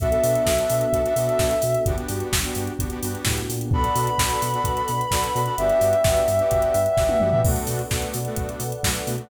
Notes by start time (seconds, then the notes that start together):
0.00 B1 B3 D4 F#4 A4 E5, kick, closed hi-hat
0.11 B3 D4 F#4 A4, closed hi-hat
0.23 B2, open hi-hat
0.35 closed hi-hat
0.46 B1, kick, snare
0.58 B3 D4 F#4 A4, closed hi-hat
0.70 B2, open hi-hat
0.81 closed hi-hat
0.93 B1 B3 D4 F#4 A4, kick, closed hi-hat
1.05 B3 D4 F#4 A4, closed hi-hat
1.16 B2 B3 D4 F#4 A4, open hi-hat
1.29 closed hi-hat
1.39 B1, kick, snare
1.51 closed hi-hat
1.62 B2, open hi-hat
1.75 closed hi-hat
1.86 G1 B3 D4 F#4 G4, kick, closed hi-hat
1.98 B3 D4 F#4 G4, closed hi-hat
2.09 G2, open hi-hat
2.20 closed hi-hat
2.32 G1, kick, snare
2.44 B3 D4 F#4 G4, closed hi-hat
2.55 G2, open hi-hat
2.67 closed hi-hat
2.79 G1 B3 D4 F#4 G4, kick, closed hi-hat
2.90 B3 D4 F#4 G4, closed hi-hat
3.02 G2 B3 D4 F#4 G4, open hi-hat
3.15 closed hi-hat
3.25 A2, kick, snare
3.38 closed hi-hat
3.49 A#2, open hi-hat
3.61 closed hi-hat
3.71 B1 B3 D4 F#4 A4 B4 D5 F#5 B5, kick
3.84 closed hi-hat
3.95 B2, open hi-hat
4.07 closed hi-hat
4.18 B1 B3 D4 F#4 A4, kick, snare
4.30 closed hi-hat
4.42 B2, open hi-hat
4.54 B3 D4 F#4 A4, closed hi-hat
4.64 B1, kick, closed hi-hat
4.77 closed hi-hat
4.88 B2, open hi-hat
5.01 closed hi-hat
5.11 B1 B3 D4 F#4 A4, kick, snare
5.24 closed hi-hat
5.35 B2 B3 D4 F#4 A4, open hi-hat
5.46 B3 D4 F#4 A4, closed hi-hat
5.57 G1 B3 D4 F#4 G4 B4 D5 E5 F#5 G5, closed hi-hat
5.69 closed hi-hat
5.81 G2, open hi-hat
5.93 closed hi-hat
6.04 G1 B3 D4 F#4 G4, kick, snare
6.17 closed hi-hat
6.28 G2, open hi-hat
6.39 B3 D4 F#4 G4, closed hi-hat
6.51 G1, kick, closed hi-hat
6.62 closed hi-hat
6.74 G2, open hi-hat
6.86 closed hi-hat
6.97 G1 B3 D4 F#4 G4, kick, snare
7.09 high tom
7.20 G2 B3 D4 F#4 G4, mid tom
7.32 B3 D4 F#4 G4, floor tom
7.44 B1 A3 B3 D4 F#4 A4 B4 D5 F#5, kick, crash
7.56 closed hi-hat
7.67 B2, open hi-hat
7.79 closed hi-hat
7.91 B1 A3 B3 D4 F#4, kick, snare
8.02 closed hi-hat
8.14 B2, open hi-hat
8.25 A3 B3 D4 F#4, closed hi-hat
8.36 B1, kick, closed hi-hat
8.49 closed hi-hat
8.60 B2, open hi-hat
8.72 closed hi-hat
8.83 B1 A3 B3 D4 F#4, kick, snare
8.95 closed hi-hat
9.07 B2 A3 B3 D4 F#4, open hi-hat
9.18 A3 B3 D4 F#4, closed hi-hat